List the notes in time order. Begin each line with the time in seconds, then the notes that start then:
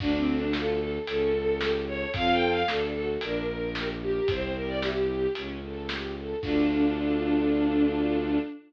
0.00 D2 D4, kick, crash
0.17 C4
0.27 A4
0.35 D4
0.53 F4 A4, snare
0.80 A4
1.07 C#2 C#4 A4, closed hi-hat
1.33 A4
1.61 G4 A4, snare
1.87 A4 C#5
2.14 F2 C4 F4 A4 F5, kick, closed hi-hat
2.32 G5
2.50 F5
2.67 D2 D4 A4, snare
2.94 F#4 A4
3.21 A#1 D4 A#4, closed hi-hat
3.48 A#4
3.75 G4 A#4, snare
4.02 G4 A#4
4.28 C2 C4 C5, kick, closed hi-hat
4.55 G4 A#4
4.68 D5
4.81 E4 G4, snare
5.09 G4
5.35 C#2 C#4, closed hi-hat
5.62 A4
5.89 G4, snare
6.16 A4
6.43 D2 D4 F4 A4, kick, crash